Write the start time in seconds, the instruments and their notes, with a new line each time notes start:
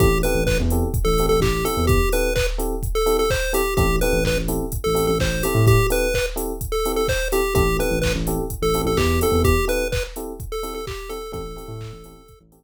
0.00 synth bass 2 A1, electric piano 1 C4 E4 G4 A4, lead 1 (square) G4, kick, closed hi-hat
0.23 electric piano 1 C4 E4 G4 A4, lead 1 (square) B4, open hi-hat
0.35 synth bass 2 A1
0.47 lead 1 (square) B4, kick, clap
0.60 synth bass 2 E2
0.70 electric piano 1 C4 E4 G4 A4, open hi-hat
0.94 kick, closed hi-hat
1.05 synth bass 2 A1, lead 1 (square) A4
1.18 electric piano 1 C4 E4 G4 A4, open hi-hat
1.29 synth bass 2 A1, lead 1 (square) A4
1.41 synth bass 2 A1, lead 1 (square) G4, kick, clap
1.65 electric piano 1 C4 E4 G4 A4, lead 1 (square) A4, open hi-hat
1.77 synth bass 2 E2
1.87 lead 1 (square) G4, kick, closed hi-hat
2.12 electric piano 1 C4 E4 G4 A4, lead 1 (square) B4, open hi-hat
2.35 lead 1 (square) B4, kick, clap
2.58 electric piano 1 C4 E4 G4 A4, open hi-hat
2.83 kick, closed hi-hat
2.95 lead 1 (square) A4
3.06 electric piano 1 C4 E4 G4 A4, open hi-hat
3.19 lead 1 (square) A4
3.30 lead 1 (square) C5, kick, clap
3.53 electric piano 1 C4 E4 G4 A4, lead 1 (square) G4, open hi-hat
3.77 synth bass 2 A1, electric piano 1 C4 E4 G4 A4, lead 1 (square) G4, kick, closed hi-hat
4.01 electric piano 1 C4 E4 G4 A4, lead 1 (square) B4, open hi-hat
4.13 synth bass 2 A1
4.25 lead 1 (square) B4, kick, clap
4.37 synth bass 2 A1
4.48 electric piano 1 C4 E4 G4 A4, open hi-hat
4.72 kick, closed hi-hat
4.84 synth bass 2 A1, lead 1 (square) A4
4.95 electric piano 1 C4 E4 G4 A4, open hi-hat
5.07 synth bass 2 A1, lead 1 (square) A4
5.20 synth bass 2 A1, lead 1 (square) C5, kick, clap
5.43 electric piano 1 C4 E4 G4 A4, lead 1 (square) G4, open hi-hat
5.55 synth bass 2 A2
5.67 lead 1 (square) G4, kick, closed hi-hat
5.90 electric piano 1 C4 E4 G4 A4, lead 1 (square) B4, open hi-hat
6.14 lead 1 (square) B4, kick, clap
6.36 electric piano 1 C4 E4 G4 A4, open hi-hat
6.61 kick, closed hi-hat
6.72 lead 1 (square) A4
6.85 electric piano 1 C4 E4 G4 A4, open hi-hat
6.96 lead 1 (square) A4
7.08 lead 1 (square) C5, kick, clap
7.32 electric piano 1 C4 E4 G4 A4, lead 1 (square) G4, open hi-hat
7.55 synth bass 2 A1, electric piano 1 C4 E4 G4 A4, lead 1 (square) G4, kick, closed hi-hat
7.79 electric piano 1 C4 E4 G4 A4, lead 1 (square) B4, open hi-hat
7.91 synth bass 2 A1
8.02 lead 1 (square) B4, kick, clap
8.15 synth bass 2 A1
8.27 electric piano 1 C4 E4 G4 A4, open hi-hat
8.50 kick, closed hi-hat
8.62 synth bass 2 A1, lead 1 (square) A4
8.74 electric piano 1 C4 E4 G4 A4, open hi-hat
8.85 synth bass 2 A1, lead 1 (square) A4
8.97 synth bass 2 E2, lead 1 (square) G4, kick, clap
9.21 electric piano 1 C4 E4 G4 A4, lead 1 (square) A4, open hi-hat
9.32 synth bass 2 E2
9.44 lead 1 (square) G4, kick, closed hi-hat
9.68 electric piano 1 C4 E4 G4 A4, lead 1 (square) B4, open hi-hat
9.92 lead 1 (square) B4, kick, clap
10.16 electric piano 1 C4 E4 G4 A4, open hi-hat
10.40 kick, closed hi-hat
10.52 lead 1 (square) A4
10.63 electric piano 1 C4 E4 G4 A4, open hi-hat
10.74 lead 1 (square) A4
10.87 lead 1 (square) G4, kick, clap
11.09 electric piano 1 C4 E4 G4 A4, lead 1 (square) A4, open hi-hat
11.32 synth bass 2 A1, electric piano 1 C4 E4 G4 A4, lead 1 (square) A4, kick, closed hi-hat
11.56 electric piano 1 C4 E4 G4 A4, open hi-hat
11.68 synth bass 2 A2
11.81 kick, clap
11.93 synth bass 2 A1
12.04 electric piano 1 C4 E4 G4 A4, open hi-hat
12.28 kick, closed hi-hat
12.41 synth bass 2 A1
12.52 electric piano 1 C4 E4 G4 A4, open hi-hat